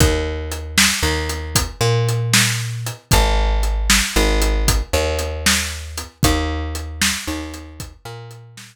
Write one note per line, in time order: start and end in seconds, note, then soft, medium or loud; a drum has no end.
0.00 0.89 D#2 medium
0.00 kick medium
0.00 closed hi-hat medium
0.52 closed hi-hat medium
0.78 snare loud
1.03 1.69 D#2 medium
1.29 closed hi-hat medium
1.55 kick medium
1.55 closed hi-hat loud
1.81 2.91 A#2 medium
2.09 closed hi-hat medium
2.33 snare loud
2.86 closed hi-hat medium
3.11 4.01 G#1 loud
3.11 kick medium
3.11 closed hi-hat medium
3.63 closed hi-hat medium
3.90 snare medium
4.16 4.82 G#1 loud
4.42 closed hi-hat medium
4.68 kick medium
4.68 closed hi-hat medium
4.93 6.04 D#2 medium
5.19 closed hi-hat medium
5.46 snare medium
5.98 closed hi-hat medium
6.23 7.13 D#2 loud
6.23 kick medium
6.23 closed hi-hat medium
6.75 closed hi-hat medium
7.02 snare loud
7.27 7.94 D#2 medium
7.54 closed hi-hat medium
7.80 kick medium
7.80 closed hi-hat medium
8.05 8.76 A#2 medium
8.31 closed hi-hat medium
8.57 snare medium